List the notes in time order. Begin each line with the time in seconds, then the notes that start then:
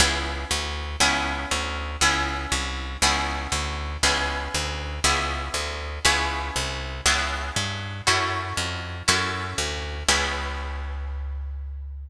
0.00 C#2 B3 C#4 E4 G#4
0.51 D2
1.00 C#2 B3 C#4 E4 G#4
1.51 D2
2.01 C#2 B3 C#4 E4 G#4
2.52 C2
3.02 C#2 B3 C#4 E4 G#4
3.52 D2
4.03 C#2 B3 C#4 E4 G#4
4.55 D2
5.04 C#2 B3 C#4 E4 G#4
5.54 D2
6.05 C#2 B3 C#4 E4 G#4
6.56 C2
7.06 C#2 B3 C#4 E4 G#4
7.56 G2
8.07 F#2 C#4 E4 F#4 A4
8.57 F2
9.08 F#2 C#4 E4 F#4 A4
9.58 D2
10.08 C#2 B3 C#4 E4 G#4